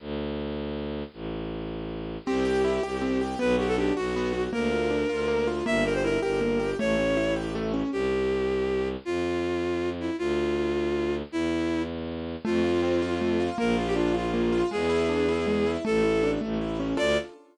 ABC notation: X:1
M:6/8
L:1/16
Q:3/8=106
K:Dm
V:1 name="Violin"
z12 | z12 | G12 | =B2 G A G2 ^F6 |
B12 | e2 B c B2 B6 | ^c6 z6 | [K:Am] G12 |
F10 E2 | F12 | E6 z6 | [K:Dm] F12 |
B2 F G F2 F6 | ^G12 | A6 z6 | d6 z6 |]
V:2 name="Acoustic Grand Piano"
z12 | z12 | C2 G2 E2 G2 C2 G2 | =B,2 ^F2 D2 F2 B,2 F2 |
B,2 F2 D2 F2 B,2 F2 | B,2 G2 E2 G2 B,2 G2 | A,2 ^C2 E2 G2 A,2 C2 | [K:Am] z12 |
z12 | z12 | z12 | [K:Dm] A,2 F2 C2 F2 A,2 F2 |
B,2 F2 D2 F2 B,2 F2 | ^G,2 E2 D2 E2 G,2 E2 | A,2 E2 D2 A,2 E2 ^C2 | [DFA]6 z6 |]
V:3 name="Violin" clef=bass
D,,12 | A,,,12 | C,,6 C,,6 | =B,,,6 B,,,6 |
D,,6 D,,6 | G,,,6 G,,,6 | A,,,12 | [K:Am] C,,12 |
F,,12 | D,,12 | E,,12 | [K:Dm] F,,12 |
B,,,12 | E,,12 | A,,,6 A,,,6 | D,,6 z6 |]